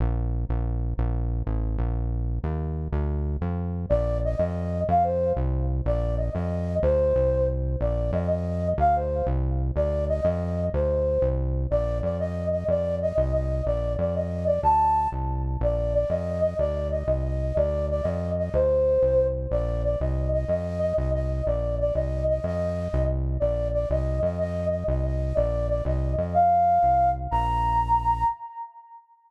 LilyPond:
<<
  \new Staff \with { instrumentName = "Flute" } { \time 6/8 \key bes \major \tempo 4. = 123 r2. | r2. | r2. | r2. |
d''4 ees''8 ees''4. | f''8 c''4 r4. | d''4 ees''8 ees''4. | c''2 r4 |
d''4 ees''8 ees''4. | f''8 c''4 r4. | d''4 ees''8 ees''4. | c''2 r4 |
d''4 d''8 ees''4 ees''8 | d''4 ees''8 ees''8 ees''4 | d''4 d''8 ees''4 d''8 | a''4. r4. |
d''4 d''8 ees''4 ees''8 | d''4 ees''8 ees''8 ees''4 | d''4 d''8 ees''4 ees''8 | c''2~ c''8 r8 |
d''4 d''8 ees''4 ees''8 | ees''4 ees''8 ees''8 ees''4 | d''4 d''8 ees''4 ees''8 | ees''2 r4 |
d''4 d''8 ees''4 ees''8 | ees''4 ees''8 ees''8 ees''4 | d''4 d''8 ees''4 ees''8 | f''2~ f''8 r8 |
bes''2. | }
  \new Staff \with { instrumentName = "Synth Bass 1" } { \clef bass \time 6/8 \key bes \major bes,,4. bes,,4. | bes,,4. a,,4 bes,,8~ | bes,,4. ees,4. | d,4. f,4. |
bes,,4. f,4. | f,4. c,4. | bes,,4. f,4. | d,4 c,2 |
bes,,4 f,2 | d,4. c,4. | d,4. f,4. | d,4. c,4. |
bes,,4 f,2 | f,4. c,4. | bes,,4 f,2 | d,4. c,4. |
bes,,4. f,4. | d,4. c,4. | d,4. f,4. | d,4. c,4. |
bes,,4. c,4. | f,4. c,4. | bes,,4. c,4. | f,4. c,4. |
bes,,4. c,4 f,8~ | f,4. c,4. | bes,,4. c,4 f,8~ | f,4. c,4. |
bes,,2. | }
>>